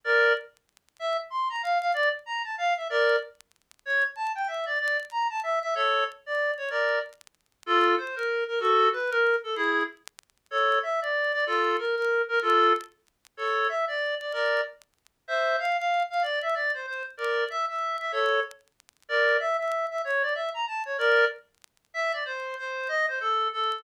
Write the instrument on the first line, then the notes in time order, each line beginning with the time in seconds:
clarinet
0.04 A#4 D5
0.99 E5
1.30 C6
1.50 A#5
1.63 F5
1.81 F5
1.94 D5
2.26 A#5
2.44 A5
2.58 F5
2.77 E5
2.90 A#4 D5
3.86 C#5
4.16 A5
4.35 G5
4.48 E5
4.66 D5
4.80 D5
5.11 A#5
5.30 A5
5.43 E5
5.62 E5
5.75 A4 C#5
6.26 D5
6.57 C#5
6.70 A#4 D5
7.66 F4 A4
7.98 C5
8.16 A#4
8.48 A#4
8.60 F#4 A4
8.92 B4
9.11 A#4
9.44 A4
9.56 E4 G#4
10.51 A4 C#5
10.83 E5
11.02 D5
11.33 D5
11.47 F4 A4
11.78 A#4
11.96 A#4
12.28 A#4
12.42 F4 A4
13.37 A4 C#5
13.69 E5
13.88 D5
14.20 D5
14.33 A#4 D5
15.28 C5 E5
15.59 F5
15.78 F5
16.10 F5
16.22 D5
16.42 E5
16.54 D5
16.74 C5
16.87 C5
17.17 A#4 D5
17.50 E5
17.69 E5
18.00 E5
18.12 A4 C#5
19.09 A#4 D5
19.40 E5
19.59 E5
19.91 E5
20.05 C#5
20.22 D5
20.35 E5
20.54 A#5
20.67 A5
20.85 C#5
20.98 A#4 D5
21.94 E5
22.13 D5
22.25 C5
22.58 C5
22.88 D#5
23.08 C5
23.21 A4
23.53 A4